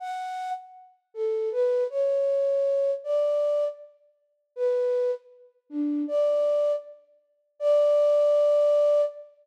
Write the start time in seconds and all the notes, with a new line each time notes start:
0.00 F#5
1.14 A4
1.52 B4
1.90 C#5
3.04 D5
4.56 B4
5.70 D4
6.08 D5
7.59 D5